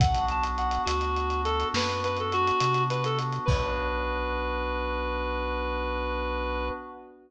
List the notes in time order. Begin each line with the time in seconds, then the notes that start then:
0.00 B1 B3 D4 F#4 F#5, kick, closed hi-hat
0.14 closed hi-hat
0.29 A5, closed hi-hat
0.43 closed hi-hat
0.58 F#5, closed hi-hat
0.71 closed hi-hat
0.85 D2 F#4, closed hi-hat
1.01 closed hi-hat
1.16 closed hi-hat
1.30 closed hi-hat
1.45 A4, closed hi-hat
1.60 closed hi-hat
1.74 F#2 B4, snare
1.89 closed hi-hat
2.04 B4, closed hi-hat
2.17 A4, closed hi-hat
2.32 F#4, closed hi-hat
2.47 closed hi-hat
2.60 C3, closed hi-hat
2.74 closed hi-hat
2.90 B4, closed hi-hat
3.04 A4, closed hi-hat
3.19 closed hi-hat
3.32 closed hi-hat
3.45 B1 B3 D4 F#4 B4, kick, crash